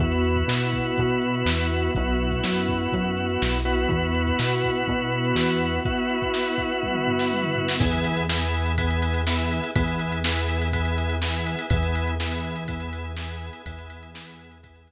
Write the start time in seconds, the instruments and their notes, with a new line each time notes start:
0.00 synth bass 1 E2, drawbar organ B3 E4 F#4, string ensemble 1 B3 E4 F#4, kick, closed hi-hat
0.12 closed hi-hat
0.24 closed hi-hat
0.36 kick, closed hi-hat
0.48 synth bass 1 B2, snare
0.61 closed hi-hat
0.73 kick, closed hi-hat
0.86 closed hi-hat
0.98 synth bass 1 B2, kick, closed hi-hat
1.09 closed hi-hat
1.22 closed hi-hat
1.34 closed hi-hat
1.46 synth bass 1 E2, snare
1.58 closed hi-hat
1.71 closed hi-hat
1.83 closed hi-hat
1.95 synth bass 1 B1, string ensemble 1 B3 E4 F#4, drawbar organ B3 E4 F#4, kick, closed hi-hat
2.08 closed hi-hat
2.31 kick, closed hi-hat
2.44 synth bass 1 F#2, snare
2.56 closed hi-hat
2.68 kick, closed hi-hat
2.80 closed hi-hat
2.92 synth bass 1 F#2, kick, closed hi-hat
3.05 closed hi-hat
3.17 closed hi-hat
3.29 closed hi-hat
3.42 synth bass 1 B1, snare
3.54 closed hi-hat
3.65 drawbar organ B3 E4 F#4, closed hi-hat
3.78 closed hi-hat
3.89 synth bass 1 E2, string ensemble 1 B3 E4 F#4, kick, closed hi-hat
4.02 closed hi-hat
4.14 closed hi-hat
4.27 kick, closed hi-hat
4.39 synth bass 1 B2, snare
4.51 closed hi-hat
4.63 kick, closed hi-hat
4.75 closed hi-hat
4.88 synth bass 1 B2, kick
5.00 closed hi-hat
5.12 closed hi-hat
5.25 closed hi-hat
5.35 synth bass 1 E2, snare
5.49 closed hi-hat
5.61 closed hi-hat
5.73 closed hi-hat
5.85 drawbar organ B3 E4 F#4, string ensemble 1 B3 E4 F#4, kick, closed hi-hat
5.97 closed hi-hat
6.10 closed hi-hat
6.22 kick, closed hi-hat
6.34 snare
6.46 closed hi-hat
6.58 kick, closed hi-hat
6.70 closed hi-hat
6.83 kick, high tom
6.95 mid tom
7.07 floor tom
7.19 snare
7.32 high tom
7.43 mid tom
7.56 floor tom
7.68 snare
7.80 synth bass 1 E2, drawbar organ B3 E4 G#4, kick, crash
7.93 ride
8.04 ride
8.17 ride
8.29 drawbar organ B3 E4 G#4, snare
8.54 ride
8.66 ride
8.78 drawbar organ B3 E4 G#4, kick, ride
8.91 ride
9.02 ride
9.14 ride
9.27 drawbar organ B3 E4 G#4, snare
9.39 ride
9.51 ride
9.64 ride
9.76 synth bass 1 E2, drawbar organ B3 E4 G#4, kick, ride
9.88 ride
9.99 ride
10.12 ride
10.24 drawbar organ B3 E4 G#4, snare
10.37 ride
10.49 ride
10.62 ride
10.73 drawbar organ B3 E4 G#4, kick, ride
10.85 ride
10.98 ride
11.10 ride
11.22 drawbar organ B3 E4 G#4, snare
11.34 ride
11.47 ride
11.59 ride
11.70 synth bass 1 E2, drawbar organ B3 E4 G#4, kick, ride
11.83 ride
11.95 ride
12.08 ride
12.20 drawbar organ B3 E4 G#4, snare
12.32 ride
12.45 ride
12.56 ride
12.68 drawbar organ B3 E4 G#4, kick, ride
12.80 ride
12.93 ride
13.17 drawbar organ B3 E4 G#4, snare, ride
13.30 ride
13.41 ride
13.53 ride
13.66 synth bass 1 E2, drawbar organ B3 E4 G#4, kick, ride
13.79 ride
13.90 ride
14.03 ride
14.14 drawbar organ B3 E4 G#4, snare
14.27 ride
14.39 ride
14.52 ride
14.63 drawbar organ B3 E4 G#4, kick, ride
14.76 ride
14.88 ride